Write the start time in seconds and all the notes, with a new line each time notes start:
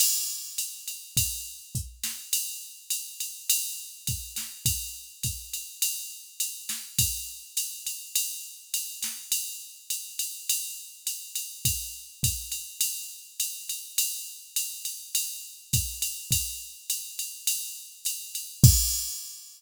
0.00 crash, ride
0.58 hi-hat pedal, ride
0.87 ride
1.17 kick, ride
1.75 kick, hi-hat pedal
2.04 snare, ride
2.33 ride
2.90 hi-hat pedal, ride
3.20 ride
3.50 ride
4.07 kick, ride
4.36 snare, ride
4.66 kick, ride
5.23 kick, hi-hat pedal, ride
5.53 ride
5.82 ride
6.40 hi-hat pedal, ride
6.69 snare, ride
6.99 kick, ride
7.57 hi-hat pedal, ride
7.87 ride
8.15 ride
8.74 ride
9.03 snare, ride
9.32 ride
9.90 hi-hat pedal, ride
10.19 ride
10.49 ride
11.07 hi-hat pedal, ride
11.35 ride
11.65 kick, ride
12.23 kick, hi-hat pedal, ride
12.52 ride
12.81 ride
13.40 hi-hat pedal, ride
13.69 ride
13.98 ride
14.56 hi-hat pedal, ride
14.85 ride
15.15 ride
15.73 kick, hi-hat pedal, ride
16.02 ride
16.31 kick, ride
16.90 hi-hat pedal, ride
17.19 ride
17.47 ride
18.05 hi-hat pedal, ride
18.35 ride
18.64 kick, crash